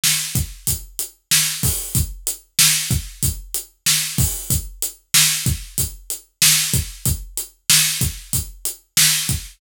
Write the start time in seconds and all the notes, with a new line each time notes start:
0.04 snare
0.35 kick, closed hi-hat
0.67 kick, closed hi-hat
0.99 closed hi-hat
1.31 snare
1.63 kick, open hi-hat
1.95 kick, closed hi-hat
2.27 closed hi-hat
2.59 snare
2.91 kick, closed hi-hat
3.23 kick, closed hi-hat
3.54 closed hi-hat
3.86 snare
4.18 kick, open hi-hat
4.50 kick, closed hi-hat
4.82 closed hi-hat
5.14 snare
5.46 kick, closed hi-hat
5.78 kick, closed hi-hat
6.10 closed hi-hat
6.42 snare
6.74 kick, closed hi-hat
7.05 kick, closed hi-hat
7.37 closed hi-hat
7.70 snare
8.01 kick, closed hi-hat
8.33 kick, closed hi-hat
8.65 closed hi-hat
8.97 snare
9.29 kick, closed hi-hat